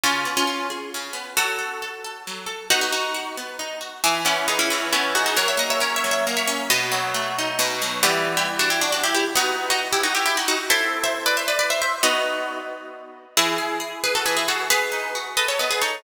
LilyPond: <<
  \new Staff \with { instrumentName = "Orchestral Harp" } { \time 3/4 \key e \major \tempo 4 = 135 <cis' eis'>8. <cis' eis'>8. r4. | <fis' a'>2. | <dis' fis'>16 <dis' fis'>16 <dis' fis'>4 r4. | <e' gis'>16 r16 <cis' e'>8 <b dis'>16 <cis' e'>16 <cis' e'>8 <cis' e'>8 <dis' fis'>16 <dis' fis'>16 |
<ais' cis''>16 <cis'' e''>16 <dis'' fis''>16 <cis'' e''>16 \tuplet 3/2 { <ais' cis''>8 <cis'' e''>8 <cis'' e''>8 } r16 <cis'' e''>8. | <b' dis''>4 r2 | \key e \minor <e' g'>8. <e' g'>16 r16 <d' fis'>16 <e' g'>16 <d' fis'>16 <d' fis'>16 <e' g'>16 <e' g'>16 r16 | <dis' fis'>8. <dis' fis'>16 r16 <e' g'>16 <dis' fis'>16 <e' g'>16 <e' g'>16 <dis' fis'>16 <dis' fis'>16 r16 |
<c'' e''>8. <c'' e''>16 r16 <b' d''>16 <c'' e''>16 <b' d''>16 <b' d''>16 <c'' e''>16 <c'' e''>16 r16 | <b' dis''>4 r2 | \key e \major <e' gis'>4. <gis' b'>16 <fis' a'>16 <gis' b'>16 <e' gis'>16 <fis' a'>8 | <gis' b'>4. <b' dis''>16 <a' cis''>16 <b' dis''>16 <gis' b'>16 <a' cis''>8 | }
  \new Staff \with { instrumentName = "Orchestral Harp" } { \time 3/4 \key e \major cis8 b8 eis'8 gis'8 cis8 b8 | fis8 a'8 a'8 a'8 fis8 a'8 | b8 r8 fis'8 b8 dis'8 fis'8 | e8 b8 gis'8 e8 b8 gis'8 |
fis8 ais8 cis'8 fis8 ais8 cis'8 | b,8 fis8 a8 dis'8 b,8 fis8 | \key e \minor <e g b>2. | <b dis'>2. |
<c' e' a'>2. | <b dis' fis'>2. | \key e \major e8 gis'8 gis'8 r8 e8 gis'8 | b8 dis'8 fis'8 a'8 b8 dis'8 | }
>>